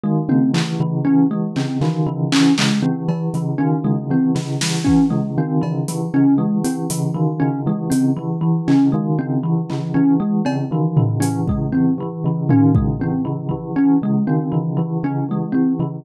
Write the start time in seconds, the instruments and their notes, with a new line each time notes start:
0.03 tubular bells D#3, kalimba G#3
0.29 tubular bells C#3, kalimba C4, high tom
0.54 kalimba E3, tubular bells E3, clap
0.80 tubular bells C#3, kalimba E3
1.05 tubular bells E3, kalimba C#4
1.31 tubular bells E3, kalimba G#3
1.56 tubular bells C#3, kalimba C4, clap
1.81 tubular bells D#3, kalimba E3, clap
2.06 tubular bells C#3, kalimba E3
2.32 tubular bells E3, kalimba C#4, clap
2.58 tubular bells C#3, kalimba G#3, clap
2.82 tubular bells E3, kalimba C4
3.08 tubular bells E3, kalimba E3, cowbell
3.34 tubular bells C#3, kalimba E3, closed hi-hat
3.58 tubular bells D#3, kalimba C#4
3.84 tubular bells C#3, kalimba G#3
4.10 tubular bells E3, kalimba C4
4.35 tubular bells C#3, kalimba E3, snare
4.61 tubular bells E3, kalimba E3, snare
4.84 tubular bells E3, kalimba C#4, kick
5.10 tubular bells C#3, kalimba G#3
5.38 tubular bells D#3, kalimba C4
5.61 tubular bells C#3, kalimba E3, cowbell
5.88 tubular bells E3, kalimba E3, closed hi-hat
6.14 tubular bells C#3, kalimba C#4
6.38 tubular bells E3, kalimba G#3
6.64 tubular bells E3, kalimba C4, closed hi-hat
6.90 tubular bells C#3, kalimba E3, closed hi-hat
7.14 tubular bells D#3, kalimba E3
7.40 tubular bells C#3, kalimba C#4
7.66 tubular bells E3, kalimba G#3
7.90 tubular bells C#3, kalimba C4, closed hi-hat
8.17 kalimba E3, tubular bells E3
8.41 kalimba E3, tubular bells E3
8.68 tubular bells C#3, kalimba C#4, clap
8.92 tubular bells D#3, kalimba G#3
9.19 tubular bells C#3, kalimba C4
9.43 kalimba E3, tubular bells E3
9.70 tubular bells C#3, kalimba E3, clap
9.94 tubular bells E3, kalimba C#4
10.20 tubular bells E3, kalimba G#3
10.45 tubular bells C#3, kalimba C4, cowbell
10.71 tubular bells D#3, kalimba E3
10.97 tubular bells C#3, kalimba E3, floor tom
11.20 tubular bells E3, kalimba C#4, closed hi-hat
11.48 tubular bells C#3, kalimba G#3, kick
11.72 tubular bells E3, kalimba C4
11.98 tubular bells E3, kalimba E3
12.24 tubular bells C#3, kalimba E3
12.49 tubular bells D#3, kalimba C#4, floor tom
12.75 tubular bells C#3, kalimba G#3, kick
13.00 tubular bells E3, kalimba C4
13.25 tubular bells C#3, kalimba E3
13.49 kalimba E3, tubular bells E3, kick
13.76 tubular bells E3, kalimba C#4
14.02 tubular bells C#3, kalimba G#3
14.27 tubular bells D#3, kalimba C4
14.52 tubular bells C#3, kalimba E3
14.77 kalimba E3, tubular bells E3
15.03 tubular bells C#3, kalimba C#4
15.29 tubular bells E3, kalimba G#3
15.52 tubular bells E3, kalimba C4
15.79 tubular bells C#3, kalimba E3